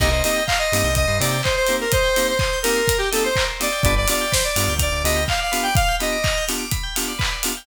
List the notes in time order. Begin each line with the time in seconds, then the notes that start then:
0.00 C2 A#3 C4 D#4 G4 A#4 D#5, kick, crash
0.11 C5 D#5
0.24 A#3 C4 D#4 G4 D#5, open hi-hat
0.36 G5
0.47 F5 A#5, kick, clap
0.59 D#5 C6
0.72 G2 A#3 C4 D#4 G4 D#6, open hi-hat
0.84 C2 G6
0.95 D#5 D#6, kick, closed hi-hat
1.07 G2 C6
1.19 C3 A#3 C4 D#4 G4 D5 A#5, open hi-hat
1.31 G5
1.43 C5 D#5, kick, clap
1.56 C5
1.67 A#3 C4 D#4 G4 A#4, open hi-hat
1.81 A#4 C5
1.92 C5 D#5, kick, closed hi-hat
2.04 G5
2.16 A#3 C4 D#4 G4 A#5, open hi-hat
2.27 C5 C6
2.39 C5 D#6, kick, clap
2.53 G6
2.63 A#3 C4 D#4 G4 A#4 D#6, open hi-hat
2.77 C6
2.88 A#5, kick, closed hi-hat
2.98 G4 G5
3.11 A#3 C4 D#4 G4 A4 D#5, open hi-hat
3.24 C5
3.36 A#4, kick, clap
3.49 C5
3.60 A#3 C4 D#4 G4 D5 D#5, open hi-hat
3.72 G5
3.83 G1 B3 D4 F4 G4 B4 D5, kick, closed hi-hat
3.97 D5
4.07 B3 D4 F4 G4 D5 F5, open hi-hat
4.21 G5
4.32 C5 B5, kick, snare
4.44 D5 D6
4.56 G2 B3 D4 F4 G4 F6, open hi-hat
4.68 D2 G6
4.79 D5 F6, kick, closed hi-hat
4.92 D2 D6
5.04 D2 B3 D4 F4 G4 D#5 B5, open hi-hat
5.16 G5
5.28 F5, kick, clap
5.40 D5 F5
5.52 B3 D4 F4 G4 B4, open hi-hat
5.63 D5 G5
5.75 F5, kick, closed hi-hat
5.88 G5
6.00 B3 D4 F4 G4 D#5 B5, open hi-hat
6.12 D6
6.24 F6, kick, clap
6.38 G6
6.48 B3 D4 F4 G4 F6, open hi-hat
6.59 D6
6.71 B5, kick, closed hi-hat
6.83 G5
6.96 B3 D4 F4 G4 F5, open hi-hat
7.08 D5
7.19 B4, kick, clap
7.31 D5
7.43 B3 D4 F4 G4 F5, open hi-hat
7.57 G5